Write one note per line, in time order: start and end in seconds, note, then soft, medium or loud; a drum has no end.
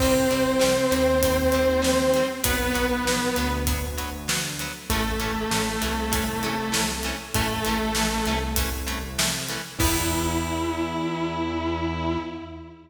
0.00 0.25 C2 medium
0.00 0.14 G3 loud
0.00 2.25 C4 loud
0.00 0.14 C4 loud
0.00 2.25 C5 loud
0.00 kick medium
0.00 crash medium
0.30 0.57 C2 medium
0.30 0.43 G3 medium
0.30 0.43 C4 medium
0.30 closed hi-hat medium
0.59 0.88 C2 medium
0.59 0.72 G3 loud
0.59 0.72 C4 medium
0.59 snare medium
0.91 2.22 D#2 medium
0.91 1.03 G3 loud
0.91 1.03 C4 medium
0.91 closed hi-hat medium
1.23 1.36 G3 medium
1.23 1.36 C4 medium
1.23 kick medium
1.23 closed hi-hat medium
1.52 1.66 G3 medium
1.52 1.66 C4 loud
1.52 closed hi-hat medium
1.82 1.94 G3 medium
1.82 1.94 C4 loud
1.82 snare medium
2.14 2.28 G3 medium
2.14 2.28 C4 medium
2.14 closed hi-hat medium
2.44 2.71 B1 medium
2.44 2.56 F#3 loud
2.44 2.56 B3 loud
2.44 3.52 B3 loud
2.44 3.52 B4 loud
2.44 kick medium
2.44 closed hi-hat loud
2.74 3.02 B1 medium
2.74 2.86 F#3 loud
2.74 2.86 B3 medium
2.74 closed hi-hat medium
3.04 3.30 B1 medium
3.04 3.19 F#3 medium
3.04 3.19 B3 medium
3.04 snare medium
3.36 4.67 D2 medium
3.36 3.49 F#3 loud
3.36 3.49 B3 loud
3.36 closed hi-hat medium
3.67 3.80 F#3 medium
3.67 3.80 B3 medium
3.67 kick medium
3.67 closed hi-hat medium
3.98 4.10 F#3 medium
3.98 4.10 B3 medium
3.98 closed hi-hat medium
4.28 4.40 F#3 medium
4.28 4.40 B3 loud
4.28 snare loud
4.59 4.72 F#3 medium
4.59 4.72 B3 medium
4.59 closed hi-hat medium
4.90 5.16 A1 medium
4.90 5.03 E3 loud
4.90 6.87 A3 loud
4.90 5.03 A3 loud
4.90 5.03 C#4 loud
4.90 6.87 A4 loud
4.90 kick medium
4.90 closed hi-hat medium
5.20 5.46 A1 medium
5.20 5.32 E3 medium
5.20 5.32 A3 medium
5.20 5.32 C#4 loud
5.20 closed hi-hat medium
5.51 5.77 A1 medium
5.51 5.65 E3 medium
5.51 5.65 A3 loud
5.51 5.65 C#4 medium
5.51 snare medium
5.81 7.12 C2 medium
5.81 5.94 E3 loud
5.81 5.94 A3 medium
5.81 5.94 C#4 medium
5.81 closed hi-hat medium
6.12 6.24 E3 loud
6.12 6.24 A3 medium
6.12 6.24 C#4 loud
6.12 kick medium
6.12 closed hi-hat medium
6.43 6.55 E3 medium
6.43 6.55 A3 loud
6.43 6.55 C#4 medium
6.43 closed hi-hat medium
6.72 6.84 E3 medium
6.72 6.84 A3 medium
6.72 6.84 C#4 medium
6.72 snare loud
7.03 7.16 E3 medium
7.03 7.16 A3 medium
7.03 7.16 C#4 loud
7.03 closed hi-hat medium
7.34 7.60 A1 medium
7.34 7.48 E3 loud
7.34 8.35 A3 loud
7.34 7.48 A3 loud
7.34 7.48 C#4 loud
7.34 8.35 A4 loud
7.34 kick medium
7.34 closed hi-hat medium
7.65 7.93 A1 medium
7.65 7.78 E3 loud
7.65 7.78 A3 loud
7.65 7.78 C#4 medium
7.65 closed hi-hat medium
7.95 8.21 A1 medium
7.95 8.08 E3 medium
7.95 8.08 A3 medium
7.95 8.08 C#4 medium
7.95 snare medium
8.26 9.57 C2 medium
8.26 8.39 E3 medium
8.26 8.39 A3 loud
8.26 8.39 C#4 medium
8.26 closed hi-hat medium
8.56 8.69 E3 loud
8.56 8.69 A3 medium
8.56 8.69 C#4 medium
8.56 kick medium
8.56 closed hi-hat loud
8.87 8.99 E3 medium
8.87 8.99 A3 loud
8.87 8.99 C#4 medium
8.87 closed hi-hat medium
9.18 9.31 E3 medium
9.18 9.31 A3 loud
9.18 9.31 C#4 medium
9.18 snare loud
9.49 9.62 E3 medium
9.49 9.62 A3 loud
9.49 9.62 C#4 medium
9.49 closed hi-hat medium
9.79 12.17 E2 loud
9.79 12.18 E3 medium
9.79 12.18 B3 loud
9.79 12.18 E4 loud
9.79 kick loud
9.79 crash loud